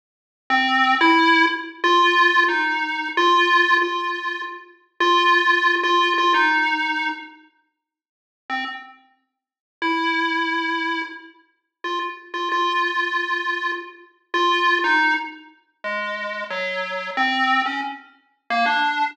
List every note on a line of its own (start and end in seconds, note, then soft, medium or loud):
0.50 0.95 C4 loud
1.01 1.46 E4 loud
1.84 2.44 F4 loud
2.48 3.08 D#4 medium
3.17 3.77 F4 loud
3.82 4.42 F4 medium
5.00 5.75 F4 loud
5.83 6.13 F4 medium
6.18 6.33 F4 medium
6.34 7.09 D#4 medium
8.50 8.65 C4 medium
9.82 11.02 E4 medium
11.84 11.99 F4 medium
12.34 12.49 F4 medium
12.52 13.72 F4 medium
14.34 14.79 F4 medium
14.84 15.14 D#4 medium
15.84 16.44 G#3 medium
16.50 17.10 F#3 medium
17.17 17.62 C4 medium
17.66 17.81 C#4 medium
18.50 18.65 A#3 medium
18.66 19.11 D4 medium